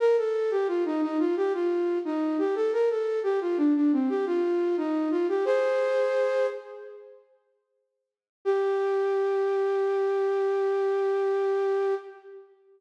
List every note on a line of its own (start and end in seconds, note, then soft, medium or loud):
0.00 0.16 A#4 loud
0.17 0.51 A4 medium
0.51 0.67 G4 loud
0.68 0.84 F4 medium
0.85 1.01 D#4 loud
1.02 1.18 D#4 loud
1.19 1.35 F4 medium
1.37 1.53 G4 loud
1.54 1.99 F4 medium
2.05 2.37 D#4 medium
2.38 2.55 G4 medium
2.55 2.71 A4 medium
2.73 2.89 A#4 medium
2.90 3.19 A4 medium
3.23 3.39 G4 medium
3.41 3.57 F4 medium
3.57 3.74 D4 loud
3.75 3.91 D4 medium
3.92 4.09 C4 loud
4.09 4.25 G4 loud
4.26 4.76 F4 loud
4.77 5.09 D#4 loud
5.11 5.27 F4 medium
5.29 5.45 G4 medium
5.45 6.47 G#4 loud
5.45 6.47 C5 loud
8.45 11.94 G4 loud